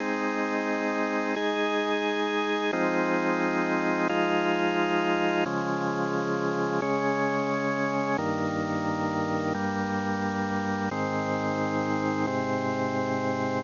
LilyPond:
\new Staff { \time 4/4 \key aes \major \tempo 4 = 88 <aes c' ees'>2 <aes ees' aes'>2 | <f aes c' ees'>2 <f aes ees' f'>2 | <des f aes>2 <des aes des'>2 | <g, ees bes>2 <g, g bes>2 |
<aes, ees c'>2 <aes, c c'>2 | }